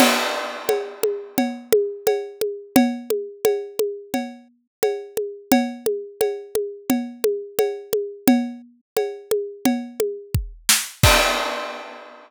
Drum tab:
CC |x-------|--------|--------|--------|
CB |x-x-x-x-|x-x-x-x-|x-x-x-x-|x-x-x---|
SD |--------|--------|--------|-------o|
CG |O-ooOooo|OoooO-oo|OoooOooo|O-ooOo--|
BD |--------|--------|--------|------o-|

CC |x-------|
CB |--------|
SD |--------|
CG |--------|
BD |o-------|